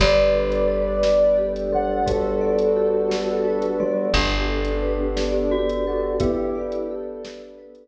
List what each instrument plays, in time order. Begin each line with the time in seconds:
0.00 electric bass (finger) G1, glockenspiel G3, pad 2 (warm) B3 D4 G4 A4, vibraphone G4, ocarina B4 D5, kick, closed hi-hat
0.34 vibraphone A4
0.52 closed hi-hat
0.68 vibraphone B4
1.03 vibraphone D5, snare
1.38 vibraphone G4
1.56 closed hi-hat
1.72 glockenspiel G3, vibraphone A4, ocarina F#5
2.06 glockenspiel G3, pad 2 (warm) B3 D4 A4 B4, ocarina F#4 A4, vibraphone B4, kick, closed hi-hat
2.41 vibraphone D5
2.59 closed hi-hat
2.76 vibraphone G4
3.10 vibraphone A4, snare
3.45 vibraphone B4
3.62 closed hi-hat
3.80 glockenspiel G3, ocarina F#4, vibraphone D5
4.13 electric bass (finger) G1, pad 2 (warm) B3 D4 G4 A4, ocarina B3 D4, vibraphone G4, glockenspiel G4, kick, closed hi-hat
4.49 vibraphone A4
4.65 closed hi-hat
4.82 vibraphone B4
5.16 vibraphone D5, snare
5.51 glockenspiel F#4, vibraphone G4
5.69 closed hi-hat
5.87 ocarina F#4, vibraphone A4
6.20 pad 2 (warm) B3 D4 A4 B4, glockenspiel B3, ocarina E4 G4, vibraphone B4, kick, closed hi-hat
6.55 vibraphone D5
6.72 closed hi-hat
6.90 vibraphone G4, ocarina A4
7.23 vibraphone A4, snare
7.58 vibraphone B4
7.75 closed hi-hat